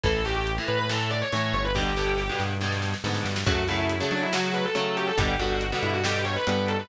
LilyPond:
<<
  \new Staff \with { instrumentName = "Distortion Guitar" } { \time 4/4 \key fis \phrygian \tempo 4 = 140 a'8 g'16 g'16 r8 b'16 b'16 a'8 d''16 cis''16 cis''8 cis''16 b'16 | g'4. r2 r8 | fis'8 e'16 e'16 r8 d'16 e'16 fis'8 b'16 a'16 a'8 g'16 a'16 | g'8 fis'16 fis'16 r8 e'16 fis'16 g'8 cis''16 b'16 b'8 a'16 b'16 | }
  \new Staff \with { instrumentName = "Overdriven Guitar" } { \time 4/4 \key fis \phrygian <a, e>8 <a, e>8. <a, e>8. <a, e>4 <a, e>4 | <g, b, d>8 <g, b, d>8. <g, b, d>8. <g, b, d>4 <g, b, d>4 | <cis fis a>8 <cis fis a>8. <cis fis a>8. <cis fis a>4 <cis fis a>4 | <b, d g>8 <b, d g>8. <b, d g>8. <b, d g>4 <b, d g>4 | }
  \new Staff \with { instrumentName = "Synth Bass 1" } { \clef bass \time 4/4 \key fis \phrygian a,,4. a,4. a,8 g,,8~ | g,,4. g,4. gis,8 g,8 | fis,4. fis4. fis4 | g,,4. g,4. g,4 | }
  \new DrumStaff \with { instrumentName = "Drums" } \drummode { \time 4/4 <hh bd>8 hh8 hh8 hh8 sn8 hh8 hh8 hh8 | <bd sn>8 sn8 sn8 sn8 sn16 sn16 sn16 sn16 sn16 sn16 sn16 sn16 | <hh bd>8 hh8 hh8 hh8 sn8 hh8 hh8 hh8 | <hh bd>8 hh8 hh8 hh8 sn8 hh8 hh8 hh8 | }
>>